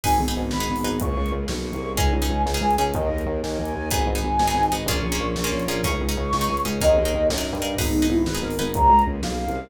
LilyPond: <<
  \new Staff \with { instrumentName = "Flute" } { \time 6/8 \key gis \minor \tempo 4. = 124 gis''4 r8 b''4. | cis'''4 r8 cis'''4. | gis''4. r8 gis''8 gis''8 | dis''4 r8 gis''4. |
gis''2~ gis''8 r8 | cis'''2~ cis'''8 r8 | cis'''2~ cis'''8 r8 | dis''4. r4. |
dis'4 e'8 b'8 ais'8 ais'8 | ais''4 r8 eis''4. | }
  \new Staff \with { instrumentName = "Pizzicato Strings" } { \time 6/8 \key gis \minor <dis' gis' b'>8. <dis' gis' b'>4 <dis' gis' b'>8. <dis' gis' b'>8 | r2. | <cis' dis' gis'>8. <cis' dis' gis'>4 <cis' dis' gis'>8. <cis' dis' gis'>8 | r2. |
<b dis' gis'>8. <b dis' gis'>4 <b dis' gis'>8. <b dis' gis'>8 | <ais cis' eis' gis'>8. <ais cis' eis' gis'>4 <ais cis' eis' gis'>8. <ais cis' eis' gis'>8 | <cis' dis' gis'>8. <cis' dis' gis'>4 <cis' dis' gis'>8. <cis' dis' gis'>8 | <dis' gis' ais'>8. <dis' gis' ais'>4 <dis' gis' ais'>8. <dis' gis' ais'>8 |
<dis' gis' b'>8. <dis' gis' b'>4 <dis' gis' b'>8. <dis' gis' b'>8 | r2. | }
  \new Staff \with { instrumentName = "Synth Bass 2" } { \clef bass \time 6/8 \key gis \minor gis,,8 gis,,8 gis,,8 gis,,8 gis,,8 gis,,8 | cis,8 cis,8 cis,8 b,,8. c,8. | cis,8 cis,8 cis,8 cis,8 cis,8 cis,8 | dis,8 dis,8 dis,8 dis,8 dis,8 dis,8 |
gis,,8 gis,,8 gis,,8 gis,,8 gis,,8 gis,,8 | ais,,8 ais,,8 ais,,8 ais,,8 ais,,8 ais,,8 | cis,8 cis,8 cis,8 cis,8 cis,8 cis,8 | dis,8 dis,8 dis,8 fis,8. g,8. |
gis,,8 gis,,8 gis,,8 gis,,8 gis,,8 gis,,8 | cis,8 cis,8 cis,8 b,,8. c,8. | }
  \new Staff \with { instrumentName = "String Ensemble 1" } { \time 6/8 \key gis \minor <b dis' gis'>4. <gis b gis'>4. | <ais cis' eis' gis'>4. <ais cis' gis' ais'>4. | <cis' dis' gis'>4. <gis cis' gis'>4. | <dis' gis' ais'>4. <dis' ais' dis''>4. |
<dis' gis' b'>4. <dis' b' dis''>4. | <cis' eis' gis' ais'>4. <cis' eis' ais' cis''>4. | <cis' dis' gis'>4. <gis cis' gis'>4. | <dis' gis' ais'>4. <dis' ais' dis''>4. |
<b dis' gis'>4. <gis b gis'>4. | <ais cis' eis' gis'>4. <ais cis' gis' ais'>4. | }
  \new DrumStaff \with { instrumentName = "Drums" } \drummode { \time 6/8 <cymc bd>8. hh8. sn8. hho8. | <hh bd>8. hh8. sn8. hh8. | <hh bd>8. hh8. sn8. hh8. | <hh bd>8. hh8. sn8. hh8. |
<hh bd>8. hh8. sn8. hh8. | <hh bd>8. hh8. sn8. hh8. | <hh bd>8. hh8. sn8. hh8. | <hh bd>8. hh8. sn8. hh8. |
<cymc bd>8. hh8. sn8. hho8. | <hh bd>8. hh8. sn8. hh8. | }
>>